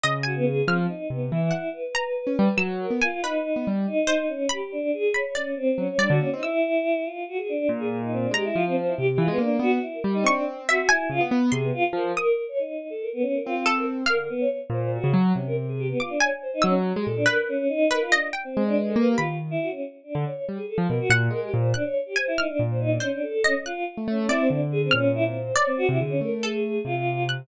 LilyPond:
<<
  \new Staff \with { instrumentName = "Acoustic Grand Piano" } { \time 9/8 \partial 4. \tempo 4. = 94 des4. | f8 r8 c8 e8 r4. r16 des'16 g16 r16 | ges8. b16 r4 r16 b16 g8 r4. | r2. ges16 r16 g16 d16 bes16 c'16 |
r2. bes,4. | aes8 f4 c8 e16 aes16 bes8 b8 r8 g8 | c'4. r8 des16 b16 b8 c8 r8 f8 | r2. c'4. |
d8 r4 bes,8. des16 ges8 c4. | r4. ges8. aes16 bes,8 r4. | r4. aes4 bes8 ees4 r8 | r8. d16 r8 g16 r8 f16 b,16 r16 bes,8 aes8 bes,8 |
r2 bes,4 r4. | r8. a16 a8 c'8 d4 bes,4. | r8. c16 d8 a4. c4. | }
  \new Staff \with { instrumentName = "Choir Aahs" } { \time 9/8 \partial 4. r8 ges'16 b16 aes'8 | c'8 ees'8 b8 e'4 b'8 b'4. | r8 bes'8 f'8 ees'4 r8 ees'4 des'8 | g'8 d'8 aes'8 des''8 des'8 c'8 des'16 des''16 d'16 ges'16 des'16 ees'16 |
e'4. f'8 ges'16 aes'16 d'8 r16 aes'16 r16 ees'16 c'16 d'16 | g'16 e'16 f'16 c'16 c''16 e'16 g'16 g'16 f'16 b16 d'16 d'16 ges'16 r16 e'16 bes'16 r16 ees'16 | d'8 r8 ges'8 e'16 e'16 f'16 r8. aes'16 b16 f'16 f'16 bes'16 r16 | bes'8 r16 des''16 ees'8. a'16 bes'16 b16 des'16 bes'16 f'8 r16 bes'16 r8 |
bes'16 bes'16 b16 des''16 r8 c''8 ges'8 r8 des'16 bes'16 r16 aes'16 g'16 b16 | f'16 d'16 des''16 r16 c''16 ees'16 des'16 r8 g'16 a'16 d'16 bes'8 des'8 ees'8 | bes'16 f'16 d'16 r8 c'8 d'16 b'16 a'16 b'16 g'16 f'16 r8 e'16 ges'16 des'16 | r8 d'8 des''8 r16 aes'16 a'16 r16 bes'16 ges'16 r8 bes'16 g'16 c''8 |
d'16 des''16 r16 g'16 c''16 e'16 ees'16 d'16 r16 c''16 ees'16 d'16 des'16 d'16 a'16 a'16 des'16 r16 | f'8 r8 des'8 e'16 c'16 d'16 r16 aes'16 c'16 des'8 e'16 c'16 c''8 | des''16 c'16 ges'16 e'16 aes'16 des'16 bes'8 aes'4 f'4 r8 | }
  \new Staff \with { instrumentName = "Harpsichord" } { \time 9/8 \partial 4. ees''8 aes''4 | f'''2 ges''4 bes''4. | e'''8 r8 aes''8 b'4. r8 c''4 | b''4. b''8 d''4. d''4 |
e'''2~ e'''8 r2 | bes''2. r4. | des'''4 e''8 aes''4 r8 c'''4. | ees'''2~ ees'''8 r4 a'4 |
f''4. r2. | d'''8 aes''4 e'''8 r4 b'4 r8 | b'8 ees''8 g''8 r4. b''4. | r2. ges''4. |
ges'''8 r8 aes''8 f'''4. c''4 ees''8 | ges'''4. d''4. f'''4. | d''4 r4 a'2 ges'''8 | }
>>